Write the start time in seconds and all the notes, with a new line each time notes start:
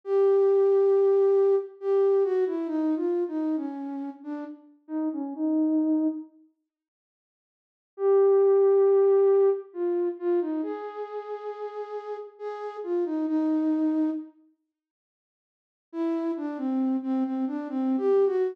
0.04 G4
1.81 G4
2.24 F#4
2.46 E4
2.67 D#4
2.96 F4
3.28 D#4
3.56 C#4
4.23 D4
4.88 D#4
5.13 C#4
5.35 D#4
7.97 G4
9.73 F4
10.19 F4
10.41 D#4
10.63 G#4
12.39 G#4
12.83 F4
13.05 D#4
13.27 D#4
15.92 E4
16.37 D4
16.57 C4
17.03 C4
17.24 C4
17.47 D4
17.69 C4
17.97 G4
18.26 F#4